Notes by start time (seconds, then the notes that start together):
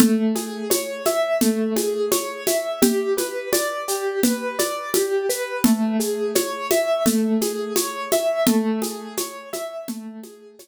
0.00 A3, low conga, shaker
0.35 G#4, high conga, shaker
0.70 C#5, high conga, shaker
1.05 E5, high conga, shaker
1.41 A3, low conga, shaker
1.76 G#4, high conga, shaker
2.11 C#5, high conga, shaker
2.47 E5, high conga, shaker
2.82 G4, low conga, shaker
3.17 B4, high conga, shaker
3.53 D5, high conga, shaker
3.88 G4, shaker
4.23 B4, low conga, shaker
4.59 D5, high conga, shaker
4.94 G4, high conga, shaker
5.29 B4, shaker
5.64 A3, low conga, shaker
6.00 G#4, shaker
6.35 C#5, high conga, shaker
6.71 E5, high conga, shaker
7.06 A3, low conga, shaker
7.41 G#4, high conga, shaker
7.76 C#5, high conga, shaker
8.12 E5, high conga, shaker
8.46 A3, low conga, shaker
8.82 G#4, high conga, shaker
9.17 C#5, high conga, shaker
9.53 E5, high conga, shaker
9.88 A3, low conga, shaker
10.23 G#4, high conga, shaker
10.59 C#5, high conga, shaker